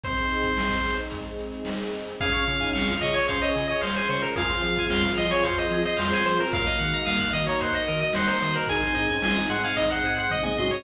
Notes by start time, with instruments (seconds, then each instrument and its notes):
0.03 flute C3 C4, string ensemble 1 C4 D#4 G#4, lead 1 (square) C5, kick, closed hi-hat
0.17 closed hi-hat
0.29 closed hi-hat
0.43 kick, closed hi-hat
0.57 snare
0.70 kick, closed hi-hat
0.84 closed hi-hat
0.98 closed hi-hat
1.10 flute G#2 G#3, kick, closed hi-hat
1.25 closed hi-hat
1.39 closed hi-hat
1.52 closed hi-hat
1.65 snare
1.78 closed hi-hat
1.94 closed hi-hat
2.07 closed hi-hat
2.20 synth bass 1 C#2, flute C#3 C#4, string ensemble 1 C#4 F4 G#4, lead 1 (square) G#4 F5, kick, closed hi-hat
2.32 flute C#3 C#4, lead 1 (square) C#5, closed hi-hat
2.46 flute C#3 C#4, synth bass 1 C#3, lead 1 (square) F5, closed hi-hat
2.60 flute D#3 D#4, lead 1 (square) G#5, kick, closed hi-hat
2.73 synth bass 1 C#2, flute C3 C4, lead 1 (square) F5 C#6, snare
2.88 flute F3 F4, lead 1 (square) F6, kick, closed hi-hat
3.01 synth bass 1 C#3, lead 1 (square) D#5 C#6, closed hi-hat
3.13 lead 1 (square) C#5 G#5, closed hi-hat
3.28 synth bass 1 C#2, flute C#3 C#4, lead 1 (square) C5 F5, kick, closed hi-hat
3.41 lead 1 (square) C#5 D#5, closed hi-hat
3.55 synth bass 1 C#3, lead 1 (square) G#4, closed hi-hat
3.68 lead 1 (square) C#5 D#5, closed hi-hat
3.81 synth bass 1 C#2, lead 1 (square) C5 F5, snare
3.96 lead 1 (square) C5 G#5, closed hi-hat
4.09 flute G#2 G#3, synth bass 1 C#3, lead 1 (square) C5 C#6, closed hi-hat
4.22 lead 1 (square) A#4 F6, closed hi-hat
4.36 synth bass 1 F2, flute F3 F4, string ensemble 1 C4 F4 G#4, lead 1 (square) G#4 F5, kick, closed hi-hat
4.50 lead 1 (square) C5, closed hi-hat
4.63 synth bass 1 F3, lead 1 (square) F5, closed hi-hat
4.75 lead 1 (square) G#5, kick, closed hi-hat
4.89 synth bass 1 F2, lead 1 (square) F5 C6, snare
5.02 lead 1 (square) F6, kick, closed hi-hat
5.17 synth bass 1 F3, lead 1 (square) D#5 C6, closed hi-hat
5.31 lead 1 (square) C#5 G#5, closed hi-hat
5.43 synth bass 1 F2, lead 1 (square) C5 F5, kick, closed hi-hat
5.57 lead 1 (square) C5 D#5, closed hi-hat
5.70 synth bass 1 F3, lead 1 (square) G#4, closed hi-hat
5.84 lead 1 (square) C5 D#5, closed hi-hat
5.97 synth bass 1 F2, flute F3 F4, lead 1 (square) C5 F5, snare
6.13 lead 1 (square) C5 G#5, closed hi-hat
6.25 synth bass 1 F3, lead 1 (square) C5 C6, closed hi-hat
6.39 lead 1 (square) A#4 F6, closed hi-hat
6.51 synth bass 1 D#2, flute F#2 F#3, string ensemble 1 A#3 D#4 F#4, lead 1 (square) A#4 F5, kick, closed hi-hat
6.65 lead 1 (square) D#5, closed hi-hat
6.79 flute G#2 G#3, synth bass 1 D#3, lead 1 (square) F#5, closed hi-hat
6.91 lead 1 (square) A#5, closed hi-hat
7.05 synth bass 1 D#2, flute A#2 A#3, lead 1 (square) F5 D#6, snare
7.19 lead 1 (square) F#6, kick, closed hi-hat
7.33 synth bass 1 D#3, lead 1 (square) D#5 D#6, closed hi-hat
7.47 lead 1 (square) C#5 A#5, closed hi-hat
7.60 synth bass 1 D#2, lead 1 (square) C5 F#5, kick, closed hi-hat
7.74 lead 1 (square) D#5, closed hi-hat
7.87 synth bass 1 D#3, lead 1 (square) A#4, closed hi-hat
8.00 lead 1 (square) D#5, closed hi-hat
8.13 synth bass 1 D#2, lead 1 (square) C5 F#5, snare
8.27 lead 1 (square) C5 A#5, closed hi-hat
8.42 synth bass 1 D#3, lead 1 (square) C5 D#6, closed hi-hat
8.53 lead 1 (square) A#4 F#6, closed hi-hat
8.67 synth bass 1 G#1, flute D#3 D#4, string ensemble 1 G#3 C4 D#4, lead 1 (square) G#4 G#5, kick, closed hi-hat
8.81 flute D#3 D#4, lead 1 (square) C5, closed hi-hat
8.95 synth bass 1 G#2, flute D#3 D#4, lead 1 (square) D#5, closed hi-hat
9.08 flute C#3 C#4, lead 1 (square) G#5, kick, closed hi-hat
9.22 synth bass 1 G#1, flute F3 F4, lead 1 (square) G#5 C6, snare
9.34 flute D#3 D#4, lead 1 (square) D#6, closed hi-hat
9.50 synth bass 1 G#2, lead 1 (square) F#5 C6, closed hi-hat
9.63 lead 1 (square) F5 G#5, closed hi-hat
9.76 synth bass 1 G#1, flute D#3 D#4, lead 1 (square) D#5, kick, closed hi-hat
9.89 lead 1 (square) C5 F#5, closed hi-hat
10.03 synth bass 1 G#2, lead 1 (square) G#4, closed hi-hat
10.17 lead 1 (square) C5 F#5, closed hi-hat
10.30 synth bass 1 G#1, lead 1 (square) D#5, kick, floor tom
10.43 lead 1 (square) D#5 G#5, mid tom
10.58 synth bass 1 G#2, flute F#3 F#4, lead 1 (square) D#5 C6, high tom
10.71 lead 1 (square) C#5 D#6